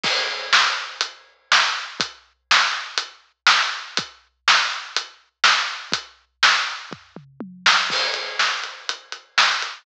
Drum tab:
CC |x-------|--------|--------|--------|
HH |----x---|x---x---|x---x---|x-------|
SD |--o---o-|--o---o-|--o---o-|--o----o|
T1 |--------|--------|--------|------o-|
T2 |--------|--------|--------|-----o--|
FT |--------|--------|--------|----o---|
BD |o-------|o-------|o-------|o---o---|

CC |x-------|
HH |-x-xxx-x|
SD |--o---o-|
T1 |--------|
T2 |--------|
FT |--------|
BD |o-------|